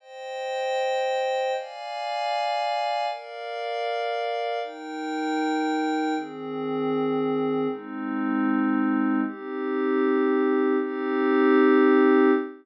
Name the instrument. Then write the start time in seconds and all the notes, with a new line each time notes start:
pad 5 (bowed)
0.00 C5 D#5 G5
1.55 D5 F5 G#5
3.07 A#4 D5 F5
4.62 D#4 A#4 G5
6.15 D#3 C4 G#4
7.68 G#3 C4 D#4
9.24 C4 D#4 G4
10.78 C4 D#4 G4